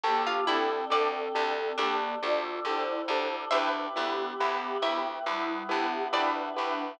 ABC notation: X:1
M:4/4
L:1/16
Q:1/4=69
K:Dm
V:1 name="Flute"
[B,G]2 [CA]6 [B,G]2 [Fd]2 [Ec]4 | [D=B]2 [=B,G]6 [G,E]2 [B,G]2 [DB]4 |]
V:2 name="Harpsichord"
z F E2 d4 D8 | [ce]6 e6 d4 |]
V:3 name="Acoustic Grand Piano"
[DGA]2 [DGA]2 [DGA]2 [DGA]2 [DGA]2 [DGA]2 [DGA]2 [DGA]2 | [EG=B]2 [EGB]2 [EGB]2 [EGB]2 [EGB]2 [EGB]2 [EGB]2 [EGB]2 |]
V:4 name="Electric Bass (finger)" clef=bass
D,,2 D,,2 D,,2 D,,2 D,,2 D,,2 D,,2 D,,2 | D,,2 D,,2 D,,2 D,,2 D,,2 D,,2 D,,2 D,,2 |]
V:5 name="Choir Aahs"
[DGA]8 [DAd]8 | [EG=B]8 [=B,EB]8 |]